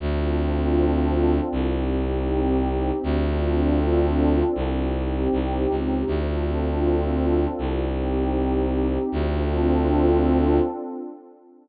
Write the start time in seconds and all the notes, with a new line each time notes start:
0.00 D2 C4 D4 F4 A4
1.52 C2 C4 D#4 G4
3.03 D2 C4 D4 F4 A4
4.55 C2 C4 D#4 G4
5.32 C2
5.70 C#2
6.07 D2 C4 D4 F4 A4
7.58 C2 C4 D#4 G4
9.11 D2 C4 D4 F4 A4